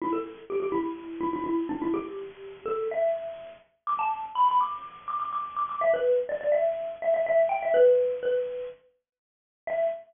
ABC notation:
X:1
M:4/4
L:1/16
Q:1/4=124
K:Em
V:1 name="Xylophone"
E A2 z G G E4 E E E2 D E | G6 A2 e6 z2 | d' a2 z b b d'4 d' d' d'2 d' d' | e B2 z d d e4 e e e2 g e |
B4 B4 z8 | e4 z12 |]